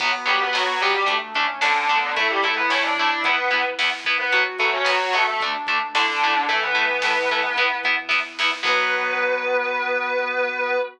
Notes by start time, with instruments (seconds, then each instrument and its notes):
0.00 synth bass 1 B1, overdriven guitar F#3 B3, lead 1 (square) B3, pad 5 (bowed) B3 F#4, kick, crash
0.26 synth bass 1 F#2, overdriven guitar F#3 B3, distortion guitar G3 G4, closed hi-hat
0.41 distortion guitar B3 B4
0.53 synth bass 1 B1, overdriven guitar F#3 B3, distortion guitar F#3 F#4, snare
0.80 overdriven guitar F#3 B3, distortion guitar G3 G4, closed hi-hat
0.95 distortion guitar G3 G4
1.06 synth bass 1 D2, overdriven guitar A3 D4, lead 1 (square) A3, pad 5 (bowed) A3 D4, kick, closed hi-hat
1.34 synth bass 1 A2, overdriven guitar A3 D4, lead 1 (square) C#4, kick, closed hi-hat
1.61 synth bass 1 D2, distortion guitar D3 D4, overdriven guitar A3 D4, snare
1.89 overdriven guitar A3 D4, lead 1 (square) B3, kick, closed hi-hat
2.16 synth bass 1 A1, pad 5 (bowed) A3 E4, distortion guitar A3 A4, overdriven guitar A3 E4, lead 1 (square) E4, kick, closed hi-hat
2.30 distortion guitar G3 G4
2.42 synth bass 1 E2, distortion guitar A3 A4, overdriven guitar A3 E4, closed hi-hat
2.56 distortion guitar B3 B4
2.70 synth bass 1 A1, overdriven guitar A3 E4, distortion guitar C#4 C#5, snare
2.83 distortion guitar D4 D5
2.97 overdriven guitar A3 E4, distortion guitar D4 D5, kick, closed hi-hat
3.24 synth bass 1 E2, pad 5 (bowed) B3 E4, distortion guitar B3 B4, overdriven guitar B3 E4, kick, closed hi-hat
3.51 synth bass 1 B2, overdriven guitar B3 E4, kick, closed hi-hat
3.79 synth bass 1 E2, overdriven guitar B3 E4, snare
4.05 overdriven guitar B3 E4, kick, closed hi-hat
4.19 distortion guitar B3 B4
4.32 synth bass 1 B1, overdriven guitar F#3 B3, pad 5 (bowed) B3 F#4, lead 1 (square) F#4, kick, closed hi-hat
4.59 synth bass 1 F#2, overdriven guitar F#3 B3, distortion guitar A3 A4, closed hi-hat
4.73 distortion guitar C#4 C#5
4.85 synth bass 1 B1, overdriven guitar F#3 B3, distortion guitar F#3 F#4, snare
5.13 overdriven guitar F#3 B3, distortion guitar A3 A4, closed hi-hat
5.27 distortion guitar A3 A4
5.40 synth bass 1 D2, pad 5 (bowed) A3 D4, overdriven guitar A3 D4, lead 1 (square) D4, kick, closed hi-hat
5.67 synth bass 1 A2, overdriven guitar A3 D4, kick, closed hi-hat
5.94 synth bass 1 D2, distortion guitar D3 D4, overdriven guitar A3 D4, lead 1 (square) E4, snare
6.08 lead 1 (square) D4
6.21 overdriven guitar A3 D4, lead 1 (square) E4, kick, closed hi-hat
6.35 lead 1 (square) D4
6.48 synth bass 1 A1, lead 1 (square) E3, distortion guitar A3 A4, overdriven guitar A3 E4, pad 5 (bowed) A3 E4, kick, closed hi-hat
6.62 distortion guitar B3 B4
6.75 synth bass 1 E2, overdriven guitar A3 E4, closed hi-hat
7.02 synth bass 1 A1, overdriven guitar A3 E4, snare
7.30 overdriven guitar A3 E4, kick, closed hi-hat
7.56 synth bass 1 E2, pad 5 (bowed) B3 E4, overdriven guitar B3 E4, kick, closed hi-hat
7.83 synth bass 1 B2, overdriven guitar B3 E4, kick, closed hi-hat
8.09 synth bass 1 E2, overdriven guitar B3 E4, kick, snare
8.39 overdriven guitar B3 E4, snare
8.63 synth bass 1 B1, overdriven guitar F#3 B3, lead 1 (square) B3, pad 5 (bowed) B3 F#4, distortion guitar B4, kick, crash